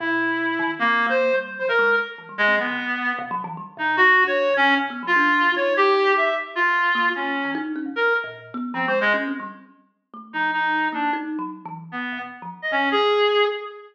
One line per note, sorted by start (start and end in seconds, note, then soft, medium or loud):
0.00 0.54 B2 loud
0.00 0.71 E4 medium
0.59 0.77 D#3 loud
0.79 1.06 A#3 medium
0.79 1.03 C4 medium
1.06 1.30 A#3 loud
1.06 1.36 C5 medium
1.33 1.57 G3 medium
1.59 1.68 F#3 medium
1.59 1.68 C5 medium
1.69 1.78 B2 medium
1.69 1.95 A#4 medium
1.79 1.97 G#3 loud
2.18 2.27 E3 soft
2.29 2.38 G3 medium
2.38 2.47 A#2 medium
2.38 2.56 G#3 loud
2.48 2.57 C4 medium
2.58 2.67 F#3 medium
2.58 3.13 B3 medium
2.68 2.77 D3 medium
3.19 3.31 C3 loud
3.31 3.43 F#3 loud
3.44 3.56 E3 loud
3.57 3.66 G3 medium
3.77 3.95 B2 medium
3.77 3.96 D#4 medium
3.97 4.22 B2 medium
3.97 4.24 F#4 loud
4.24 4.48 D4 medium
4.24 4.54 C#5 medium
4.50 4.74 D3 medium
4.57 4.75 C#4 loud
4.77 4.89 C3 medium
4.90 5.02 B3 medium
5.03 5.15 F#3 medium
5.07 5.52 F4 loud
5.16 5.43 D4 loud
5.46 5.55 F#3 soft
5.56 6.28 D#4 medium
5.56 5.74 C#5 medium
5.77 6.13 G4 loud
6.17 6.35 E5 medium
6.55 7.09 F4 medium
6.95 7.13 A#3 loud
7.15 7.51 C#4 medium
7.45 7.54 E3 medium
7.55 7.73 D#4 loud
7.76 7.85 C#4 medium
7.86 7.95 C3 soft
7.96 8.14 A#4 medium
8.24 8.51 A#2 loud
8.54 8.72 B3 loud
8.74 8.86 F3 loud
8.74 8.86 C4 medium
8.88 9.00 G#3 loud
8.88 9.00 C5 medium
9.01 9.13 C#3 medium
9.01 9.13 G#3 loud
9.14 9.26 C#4 loud
9.28 9.40 C4 medium
9.40 9.52 G3 medium
10.14 10.31 A3 medium
10.33 10.87 F3 medium
10.33 10.51 D#4 medium
10.52 10.88 D#4 medium
10.92 11.10 A#3 medium
10.92 11.11 D4 soft
11.13 11.37 D#4 loud
11.39 11.63 F#3 medium
11.65 11.89 E3 loud
11.92 12.19 B3 medium
12.12 12.21 B2 medium
12.42 12.51 F3 medium
12.62 12.71 D#5 medium
12.71 13.25 B2 medium
12.71 12.89 C#4 medium
12.92 13.45 G#4 medium